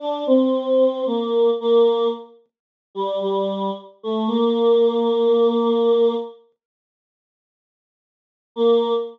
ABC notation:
X:1
M:4/4
L:1/16
Q:1/4=56
K:Bb
V:1 name="Choir Aahs"
D C3 B,2 B,2 z3 G, G,2 z A, | B,8 z8 | B,4 z12 |]